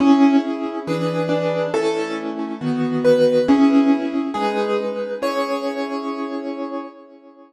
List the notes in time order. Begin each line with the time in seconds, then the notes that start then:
0.00 C#4 E4 G#4
0.87 E3 D4 G#4 B4
1.29 D4
1.74 A3 C#4 E4 A4
2.61 D#3 B3 F#4
3.05 B4
3.48 C#4 E4 G#4
4.34 G#3 D#4 G#4 B4
5.22 C#4 E4 G#4 C#5